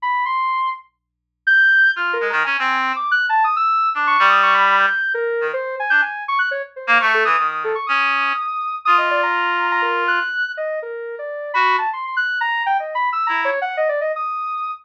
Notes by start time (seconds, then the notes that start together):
0.02 B5
0.26 C6
1.47 G6
1.96 F4 F6
2.13 A#4
2.21 G#3
2.30 D#3 A#5
2.44 C#4 G#5
2.59 C4
2.96 D6
3.11 F#6
3.29 A5
3.44 D#6
3.56 E6
3.94 D4 D6
4.07 C#6
4.19 G3
4.29 D#6
4.43 C#6
4.54 B5
4.80 G6
5.14 A#4
5.41 D#3
5.53 C5
5.80 G#5
5.90 D4 G6
6.02 G#5
6.28 C#6
6.39 F#6
6.51 C#5
6.76 C5
6.87 A#3
7.01 A3 C#6
7.14 A4
7.25 E3 D#6
7.39 D#3
7.51 D#6
7.64 A4
7.75 C#6
7.87 C#4 D#6
8.85 F4 D#6
8.98 D#5
9.11 D5
9.23 A#5
9.71 A#5
9.82 A#4
10.08 F#6
10.57 D#5
10.82 A#4
11.19 D5
11.54 F#4 B5
11.78 A5
11.93 C6
12.04 C6
12.17 F#6
12.41 A#5
12.66 G5
12.80 D#5
12.95 B5
13.12 E6
13.27 E4 A#5
13.45 C#5
13.61 F#5
13.77 D#5
13.89 D5
14.01 D#5
14.16 D#6